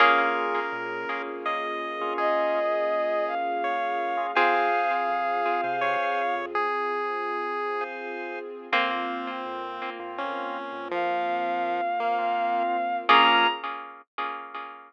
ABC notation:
X:1
M:6/8
L:1/16
Q:3/8=55
K:Bbdor
V:1 name="Violin"
z12 | e6 f6 | f12 | z12 |
z12 | f12 | b6 z6 |]
V:2 name="Lead 1 (square)"
B8 e4 | A8 d4 | A8 d4 | A8 z4 |
C8 D4 | F,6 B,4 z2 | B,6 z6 |]
V:3 name="Harpsichord"
[B,DFA]12- | [B,DFA]12 | [CFA]12- | [CFA]12 |
[B,CF]12- | [B,CF]12 | [B,DFA]6 z6 |]
V:4 name="Drawbar Organ"
[B,DFA]11 [B,DFA]- | [B,DFA]11 [B,DFA] | [cfa]7 [cfa]5- | [cfa]7 [cfa]5 |
[B,CF]7 [B,CF]5- | [B,CF]7 [B,CF]5 | [Bdfa]6 z6 |]
V:5 name="Synth Bass 1" clef=bass
B,,,4 B,,3 B,,,4 B,,,- | B,,,12 | F,,4 F,,3 C,4 F,,- | F,,12 |
F,,4 F,,3 F,,4 F,,- | F,,12 | B,,,6 z6 |]
V:6 name="String Ensemble 1"
[B,DFA]12- | [B,DFA]12 | [CFA]12- | [CFA]12 |
[B,CF]12- | [B,CF]12 | [B,DFA]6 z6 |]